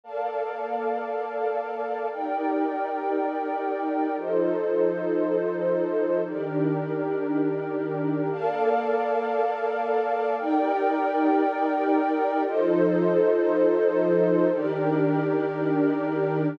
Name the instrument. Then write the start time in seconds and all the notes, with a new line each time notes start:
pad 2 (warm)
0.04 A#3 A4 A#4 D5 F5 A5
2.11 D#4 G4 A#4 D5 G5
4.17 F3 D#4 F4 A4 C5 D#5
6.24 D#3 D4 D#4 G4 A#4 D5
8.31 A#3 A4 A#4 D5 F5 A5
10.38 D#4 G4 A#4 D5 G5
12.45 F3 D#4 F4 A4 C5 D#5
14.52 D#3 D4 D#4 G4 A#4 D5